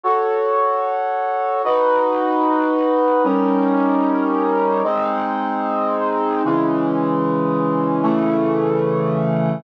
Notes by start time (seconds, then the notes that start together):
0.04 F#4 A4 C#5
1.65 D#4 F#4 B4
3.24 G3 C#4 D#4 A#4
4.84 G#3 C4 D#4
6.45 C#3 E3 G#3
8.03 C#3 E3 A3